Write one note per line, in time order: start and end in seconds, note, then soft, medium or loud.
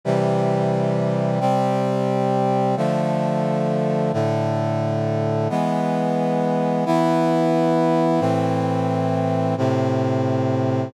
0.05 1.40 C3 medium
0.05 1.40 E3 medium
0.05 1.40 G3 medium
1.40 2.75 C3 medium
1.40 2.75 G3 medium
1.40 2.75 C4 medium
2.77 4.12 D3 medium
2.77 4.12 F3 medium
2.77 4.12 A3 medium
4.13 5.48 A2 medium
4.13 5.48 D3 medium
4.13 5.48 A3 medium
5.50 6.85 E3 medium
5.50 6.85 G#3 medium
5.50 6.85 B3 medium
6.86 8.19 E3 medium
6.86 8.21 B3 medium
6.86 8.21 E4 medium
8.20 9.55 A2 medium
8.20 9.55 E3 medium
8.20 9.55 C4 medium
9.58 10.92 A2 medium
9.58 10.92 C3 medium
9.58 10.92 C4 medium